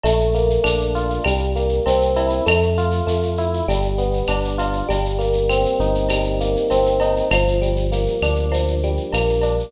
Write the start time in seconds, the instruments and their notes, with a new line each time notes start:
0.04 synth bass 1 A#1, electric piano 1 A3, cowbell, shaker
0.20 shaker
0.34 electric piano 1 A#3, shaker
0.50 shaker
0.64 synth bass 1 A#1, electric piano 1 D4, claves, shaker
0.80 shaker
0.95 electric piano 1 F4, shaker
1.10 shaker
1.24 synth bass 1 C2, electric piano 1 G3, cowbell, claves, shaker
1.39 shaker
1.56 electric piano 1 A#3, shaker
1.69 shaker
1.86 synth bass 1 C2, electric piano 1 C4, cowbell, shaker
2.01 shaker
2.16 electric piano 1 E4, cowbell, shaker
2.29 shaker
2.46 synth bass 1 F2, electric piano 1 A3, cowbell, claves, shaker
2.62 shaker
2.77 electric piano 1 F4, shaker
2.91 shaker
3.07 synth bass 1 F2, electric piano 1 A3, shaker
3.23 shaker
3.37 electric piano 1 E4, shaker
3.54 shaker
3.68 synth bass 1 G1, electric piano 1 G3, cowbell, shaker
3.82 shaker
3.98 electric piano 1 B3, shaker
4.14 shaker
4.27 synth bass 1 G1, electric piano 1 D4, cowbell, claves, shaker
4.45 shaker
4.58 electric piano 1 F4, cowbell, shaker
4.73 shaker
4.89 synth bass 1 G1, electric piano 1 G3, cowbell, shaker
5.05 shaker
5.19 electric piano 1 A#3, shaker
5.33 shaker
5.49 electric piano 1 C4, claves, shaker
5.65 shaker
5.80 synth bass 1 G1, electric piano 1 D#4, shaker
5.95 shaker
6.09 electric piano 1 G3, cowbell, claves, shaker
6.24 shaker
6.40 electric piano 1 A#3, shaker
6.56 shaker
6.70 synth bass 1 G1, electric piano 1 C4, cowbell, shaker
6.86 shaker
7.00 electric piano 1 D#4, cowbell, shaker
7.17 shaker
7.31 synth bass 1 G1, electric piano 1 F3, cowbell, claves, shaker
7.47 shaker
7.61 electric piano 1 G3, shaker
7.76 shaker
7.92 electric piano 1 A#3, shaker
8.07 shaker
8.22 synth bass 1 D2, electric piano 1 D4, claves, shaker
8.35 shaker
8.51 electric piano 1 F3, cowbell, shaker
8.68 shaker
8.83 electric piano 1 G3, shaker
8.97 shaker
9.13 synth bass 1 A#1, electric piano 1 A#3, cowbell, claves, shaker
9.29 shaker
9.42 electric piano 1 D4, cowbell, shaker
9.60 shaker